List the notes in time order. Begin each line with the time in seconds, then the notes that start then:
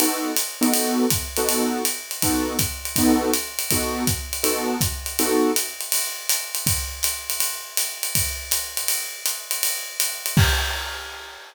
0.00 B3 D#4 F#4 A4, ride
0.36 hi-hat pedal, ride
0.61 B3 D#4 F#4 A4, ride
0.74 ride
1.10 kick, hi-hat pedal, ride
1.37 B3 D#4 F#4 A4, ride
1.49 ride
1.85 hi-hat pedal, ride
2.11 ride
2.22 B3 D#4 F#4 A4, kick, ride
2.59 kick, hi-hat pedal, ride
2.85 ride
2.96 B3 D#4 F#4 A4, kick, ride
3.34 hi-hat pedal, ride
3.59 ride
3.71 B3 D#4 F#4 A4, kick, ride
4.07 kick, hi-hat pedal, ride
4.33 ride
4.43 B3 D#4 F#4 A4, ride
4.81 kick, hi-hat pedal, ride
5.06 ride
5.19 B3 D#4 F#4 A4, ride
5.56 hi-hat pedal, ride
5.81 ride
5.92 ride
6.29 hi-hat pedal, ride
6.55 ride
6.67 kick, ride
7.03 hi-hat pedal, ride
7.30 ride
7.40 ride
7.77 hi-hat pedal, ride
8.03 ride
8.15 kick, ride
8.51 hi-hat pedal, ride
8.77 ride
8.88 ride
9.26 hi-hat pedal, ride
9.51 ride
9.63 ride
10.00 hi-hat pedal, ride
10.26 ride
10.37 kick, crash